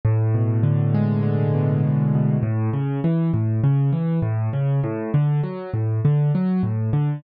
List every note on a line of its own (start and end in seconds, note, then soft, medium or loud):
0.05 1.83 A2 loud
0.35 1.53 B2 medium
0.63 1.22 D3 medium
0.94 2.37 G#3 medium
1.23 2.37 D3 medium
1.54 2.14 B2 medium
1.83 2.41 A2 medium
2.15 2.43 B2 medium
2.43 2.70 A2 loud
2.73 3.00 C#3 medium
3.04 3.31 E3 medium
3.34 3.61 A2 medium
3.64 3.91 C#3 loud
3.93 4.20 E3 medium
4.22 4.49 A2 loud
4.53 4.80 C#3 medium
4.83 5.11 A2 loud
5.14 5.41 D3 medium
5.43 5.70 F#3 medium
5.74 6.00 A2 medium
6.05 6.32 D3 medium
6.35 6.62 F#3 medium
6.63 6.90 A2 medium
6.93 7.20 D3 medium